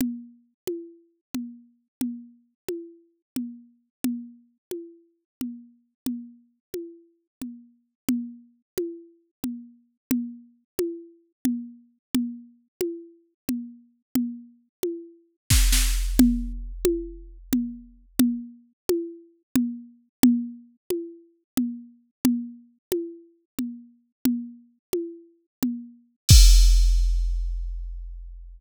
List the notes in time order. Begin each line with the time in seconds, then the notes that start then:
0.01 low conga
0.67 high conga
1.34 low conga
2.01 low conga
2.69 high conga
3.36 low conga
4.04 low conga
4.71 high conga
5.41 low conga
6.06 low conga
6.74 high conga
7.42 low conga
8.09 low conga
8.78 high conga
9.44 low conga
10.11 low conga
10.79 high conga
11.45 low conga
12.15 low conga
12.81 high conga
13.49 low conga
14.15 low conga
14.83 high conga
15.50 kick, snare
15.72 snare
16.19 low conga
16.85 high conga
17.53 low conga
18.19 low conga
18.89 high conga
19.56 low conga
20.23 low conga
20.90 high conga
21.57 low conga
22.25 low conga
22.92 high conga
23.59 low conga
24.25 low conga
24.93 high conga
25.63 low conga
26.29 kick, crash